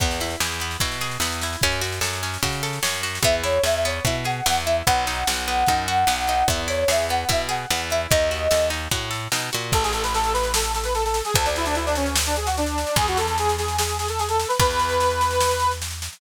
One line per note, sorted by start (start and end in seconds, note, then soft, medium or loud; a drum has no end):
0.00 0.36 E2 medium
0.00 0.19 B3 loud
0.00 kick medium
0.00 snare medium
0.11 snare medium
0.20 0.39 E4 medium
0.20 snare medium
0.30 snare medium
0.40 0.77 E2 medium
0.40 0.59 G#4 medium
0.40 snare medium
0.52 snare medium
0.60 0.80 B3 medium
0.60 snare medium
0.71 snare medium
0.80 1.18 B2 medium
0.80 0.98 E4 medium
0.80 kick medium
0.80 snare medium
0.92 snare medium
1.01 1.20 G#4 medium
1.01 snare medium
1.11 snare medium
1.20 1.56 E2 medium
1.20 1.40 B3 medium
1.20 snare medium
1.32 snare medium
1.41 1.62 E4 medium
1.41 snare medium
1.53 snare medium
1.61 2.00 F#2 medium
1.61 1.81 C#4 loud
1.61 kick medium
1.61 snare medium
1.72 snare soft
1.81 2.00 F#4 medium
1.81 snare medium
1.92 snare medium
2.01 2.38 F#2 medium
2.01 2.19 A4 medium
2.01 snare medium
2.13 snare medium
2.23 2.41 C#4 medium
2.23 snare medium
2.34 snare medium
2.43 2.79 C#3 medium
2.43 2.62 F#4 medium
2.43 kick medium
2.43 snare medium
2.53 snare medium
2.63 2.81 A4 medium
2.63 snare medium
2.73 snare medium
2.83 3.19 F#2 medium
2.83 3.01 C#4 medium
2.83 snare loud
2.95 snare medium
3.03 3.21 F#4 medium
3.03 snare medium
3.15 snare medium
3.23 3.59 E2 medium
3.23 3.43 B3 loud
3.23 3.34 E5 medium
3.23 kick medium
3.23 snare medium
3.44 3.62 E4 medium
3.44 3.61 C#5 medium
3.44 snare medium
3.64 4.00 E2 medium
3.64 3.82 G#4 medium
3.64 3.74 E5 medium
3.64 snare medium
3.75 3.84 E5 medium
3.85 4.03 B3 medium
3.85 4.04 C#5 medium
3.85 snare medium
4.05 4.41 B2 medium
4.05 4.25 E4 medium
4.05 4.15 E5 medium
4.05 kick medium
4.05 snare medium
4.24 4.44 G#4 medium
4.24 4.45 F#5 medium
4.24 snare medium
4.46 4.83 E2 medium
4.46 4.64 B3 medium
4.46 4.56 F#5 medium
4.46 snare medium
4.66 4.85 E4 medium
4.66 4.75 E5 medium
4.66 snare soft
4.86 5.24 B1 loud
4.86 5.05 B3 medium
4.86 6.45 F#5 medium
4.86 kick medium
4.86 snare medium
5.07 5.25 D#4 medium
5.07 snare medium
5.27 5.64 B1 medium
5.27 5.46 F#4 medium
5.27 snare loud
5.48 5.66 B3 medium
5.48 snare medium
5.66 6.05 F#2 medium
5.66 5.87 D#4 medium
5.66 kick medium
5.66 snare medium
5.88 6.06 F#4 medium
5.88 snare medium
6.07 6.43 B1 medium
6.07 6.26 B3 medium
6.07 snare medium
6.27 6.47 D#4 medium
6.27 snare medium
6.48 6.84 E2 medium
6.48 6.68 B3 medium
6.48 6.58 E5 medium
6.48 kick medium
6.48 snare medium
6.68 6.86 E4 medium
6.68 6.89 C#5 medium
6.68 snare medium
6.88 7.25 E2 medium
6.88 7.07 G#4 medium
6.88 6.99 E5 medium
6.88 snare loud
6.99 7.09 E5 medium
7.09 7.28 B3 medium
7.09 7.27 F#5 medium
7.09 snare medium
7.29 7.66 B2 medium
7.29 7.47 E4 medium
7.29 7.40 E5 medium
7.29 kick medium
7.29 snare medium
7.49 7.67 G#4 medium
7.49 7.67 F#5 medium
7.49 snare medium
7.70 8.07 E2 medium
7.70 7.89 B3 medium
7.70 7.80 F#5 medium
7.70 snare medium
7.90 8.10 E4 medium
7.90 8.00 E5 medium
7.90 snare medium
8.10 8.48 D#2 loud
8.10 8.30 D#4 loud
8.10 8.68 D#5 medium
8.10 kick medium
8.10 snare medium
8.31 8.49 F#4 medium
8.31 snare medium
8.51 8.88 D#2 medium
8.51 8.69 A4 medium
8.51 snare medium
8.70 8.88 D#4 medium
8.70 snare medium
8.91 9.28 A2 medium
8.91 9.10 F#4 medium
8.91 kick medium
8.91 snare medium
9.11 9.29 A4 medium
9.11 snare medium
9.32 9.50 B2 medium
9.32 9.51 D#4 medium
9.32 snare medium
9.53 9.73 A#2 medium
9.53 9.71 F#4 medium
9.53 snare medium
9.72 11.22 A1 loud
9.72 9.83 A4 medium
9.72 kick medium
9.72 snare medium
9.83 9.93 G#4 medium
9.83 snare medium
9.93 10.03 A4 medium
9.93 snare medium
10.03 10.13 B4 medium
10.03 snare medium
10.14 10.33 A4 medium
10.14 snare medium
10.24 snare medium
10.34 10.52 B4 medium
10.34 snare medium
10.43 snare medium
10.54 10.72 A4 medium
10.54 snare loud
10.64 snare medium
10.74 10.84 A4 medium
10.74 snare medium
10.84 10.94 B4 medium
10.84 snare medium
10.95 11.04 A4 medium
10.95 snare medium
11.05 11.22 A4 medium
11.05 snare medium
11.14 snare medium
11.25 11.34 G#4 medium
11.25 snare medium
11.34 12.85 D2 loud
11.34 11.45 A4 medium
11.34 kick medium
11.34 snare medium
11.46 11.55 D4 medium
11.46 snare medium
11.56 11.66 E4 medium
11.56 snare medium
11.65 11.75 D4 medium
11.65 snare medium
11.75 11.85 E4 medium
11.75 snare medium
11.86 11.96 D4 medium
11.86 snare medium
11.95 12.14 C#4 medium
11.95 snare medium
12.06 snare medium
12.16 snare loud
12.26 12.36 D4 medium
12.26 snare medium
12.36 12.46 G#4 medium
12.36 snare medium
12.46 12.56 F#4 medium
12.46 snare medium
12.57 12.96 D4 medium
12.57 snare medium
12.66 snare medium
12.78 snare medium
12.87 snare medium
12.96 14.45 E2 loud
12.96 13.07 G#4 loud
12.96 kick medium
12.96 snare medium
13.08 13.17 F#4 medium
13.08 snare medium
13.17 13.27 A4 medium
13.17 snare medium
13.27 13.38 A4 medium
13.27 snare medium
13.38 13.56 G#4 medium
13.38 snare medium
13.49 snare medium
13.58 13.76 G#4 medium
13.58 snare medium
13.68 snare medium
13.78 13.97 G#4 medium
13.78 snare loud
13.89 snare medium
13.98 14.08 G#4 medium
13.98 snare medium
14.08 14.19 A4 medium
14.08 snare medium
14.19 14.29 G#4 medium
14.19 snare medium
14.29 14.47 A4 medium
14.29 snare medium
14.40 snare medium
14.48 14.58 B4 medium
14.48 snare medium
14.60 16.09 E2 loud
14.60 15.72 B4 loud
14.60 kick medium
14.60 snare medium
14.71 snare medium
14.79 snare medium
14.89 snare medium
15.00 snare medium
15.10 snare medium
15.21 snare medium
15.31 snare medium
15.40 snare loud
15.51 snare medium
15.60 snare medium
15.71 snare medium
15.82 snare medium
15.91 snare medium
16.02 snare medium
16.13 snare medium